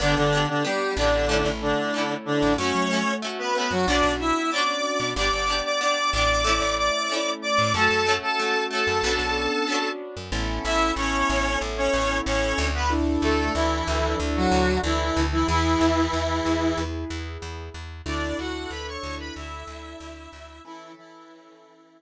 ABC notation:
X:1
M:4/4
L:1/16
Q:1/4=93
K:D
V:1 name="Lead 1 (square)"
[D,D] [D,D]2 [D,D] [G,G]2 [D,D]4 [D,D]4 [D,D]2 | [Cc]4 z [B,B] [B,B] [F,F] [Dd]2 [Ee]2 [dd']4 | [dd'] [dd']2 [dd'] [dd']2 [dd']4 [dd']4 [dd']2 | [Aa]3 [Aa]3 [Aa]8 z2 |
[K:A] z2 [Ee]2 [Cc]4 z [Cc]3 [Cc]3 [B,B] | z2 [A,A]2 [E,E]4 z [F,F]3 [E,E]3 [E,E] | [E,E]10 z6 | [Dd]2 [Ff]2 [Bb] [cc']2 [Bb] [Ee]8 |
[E,E]2 [E,E]8 z6 |]
V:2 name="Acoustic Grand Piano"
[B,DG]8 [A,CE]8 | [A,CF]8 [B,CDF]8 | [B,DG]8 [A,CE]8 | [A,CF]8 [B,CDF]8 |
[K:A] [B,CEA]16 | [DEA]16 | [EGB]16 | [DEA]16 |
[CEAB]16 |]
V:3 name="Pizzicato Strings"
[B,DG]2 [B,DG]2 [B,DG]2 [B,DG]2 [A,CE]4 [A,CE]4 | [A,CF]2 [A,CF]2 [A,CF]2 [A,CF]2 [B,CDF]4 [B,CDF]4 | [B,DG]2 [B,DG]2 [B,DG]2 [B,DG]2 [A,CE]4 [A,CE]4 | [A,CF]2 [A,CF]2 [A,CF]2 [A,CF]2 [B,CDF]4 [B,CDF]4 |
[K:A] z16 | z16 | z16 | z16 |
z16 |]
V:4 name="Electric Bass (finger)" clef=bass
G,,, G,,,5 A,,,3 A,,,6 A,,, | F,, F,6 F,, B,,, B,,,6 B,, | G,,, G,,,5 A,,,3 A,,,6 A,, | F,, F,,6 F,, B,,, B,,,6 F,, |
[K:A] A,,,2 A,,,2 A,,,2 A,,,2 A,,,2 A,,,2 A,,,2 D,,2- | D,,2 D,,2 D,,2 D,,2 D,,2 D,,2 D,,2 D,,2 | E,,2 E,,2 E,,2 E,,2 E,,2 E,,2 E,,2 E,,2 | D,,2 D,,2 D,,2 D,,2 D,,2 D,,2 D,,2 D,,2 |
z16 |]